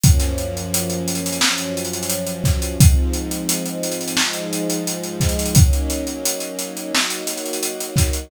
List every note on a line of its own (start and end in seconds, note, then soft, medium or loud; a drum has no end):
0.03 1.40 F#2 medium
0.03 1.40 F3 medium
0.03 1.40 A#3 medium
0.03 1.40 C#4 medium
0.03 kick medium
0.03 closed hi-hat loud
0.20 snare soft
0.20 closed hi-hat medium
0.38 closed hi-hat medium
0.57 closed hi-hat medium
0.74 closed hi-hat loud
0.90 closed hi-hat medium
1.08 closed hi-hat medium
1.15 closed hi-hat medium
1.26 closed hi-hat medium
1.32 closed hi-hat medium
1.41 2.78 F#2 medium
1.41 2.78 F3 medium
1.41 2.78 F#3 medium
1.41 2.78 C#4 medium
1.41 snare loud
1.58 closed hi-hat medium
1.77 closed hi-hat medium
1.85 closed hi-hat medium
1.93 closed hi-hat medium
2.03 closed hi-hat medium
2.10 closed hi-hat medium
2.27 closed hi-hat medium
2.44 kick medium
2.44 snare soft
2.44 closed hi-hat medium
2.62 closed hi-hat medium
2.79 4.16 G#2 medium
2.79 4.16 F3 medium
2.79 4.16 C4 medium
2.79 4.16 D#4 medium
2.79 kick loud
2.79 closed hi-hat loud
3.14 closed hi-hat medium
3.31 closed hi-hat medium
3.49 closed hi-hat medium
3.66 closed hi-hat medium
3.83 closed hi-hat medium
3.92 closed hi-hat medium
4.01 closed hi-hat medium
4.08 closed hi-hat medium
4.17 5.54 G#2 medium
4.17 5.54 F3 medium
4.17 5.54 G#3 medium
4.17 5.54 D#4 loud
4.17 snare medium
4.33 closed hi-hat medium
4.53 closed hi-hat medium
4.70 closed hi-hat medium
4.87 closed hi-hat medium
5.03 closed hi-hat medium
5.20 kick medium
5.20 snare medium
5.20 closed hi-hat medium
5.29 closed hi-hat medium
5.39 closed hi-hat medium
5.46 closed hi-hat medium
5.55 6.92 F#3 medium
5.55 6.92 A#3 medium
5.55 6.92 C#4 medium
5.55 6.92 D#4 medium
5.55 kick loud
5.55 closed hi-hat loud
5.73 closed hi-hat medium
5.90 closed hi-hat medium
6.07 closed hi-hat medium
6.25 closed hi-hat loud
6.40 closed hi-hat medium
6.59 closed hi-hat medium
6.77 closed hi-hat medium
6.94 8.30 F#3 medium
6.94 8.30 A#3 medium
6.94 8.30 D#4 medium
6.94 8.30 F#4 loud
6.94 snare medium
7.10 closed hi-hat medium
7.27 snare soft
7.27 closed hi-hat medium
7.37 closed hi-hat medium
7.46 closed hi-hat medium
7.53 closed hi-hat medium
7.63 closed hi-hat medium
7.80 closed hi-hat medium
7.96 kick medium
7.96 snare medium
7.96 closed hi-hat medium
8.13 closed hi-hat medium